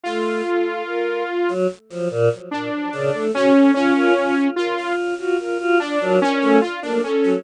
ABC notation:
X:1
M:9/8
L:1/16
Q:3/8=49
K:none
V:1 name="Lead 2 (sawtooth)"
F8 z4 D4 ^C2 | ^C4 F2 z4 D2 C2 F D C2 |]
V:2 name="Choir Aahs"
A,2 z5 ^F, z =F, ^A,, z3 ^C, =A, ^C2 | F F F z2 F2 F F F D ^F, z A, z ^A, z F, |]
V:3 name="Violin"
z2 A2 ^A2 z9 =A ^F A | z ^A z2 A z2 ^F A F z A3 z2 =A2 |]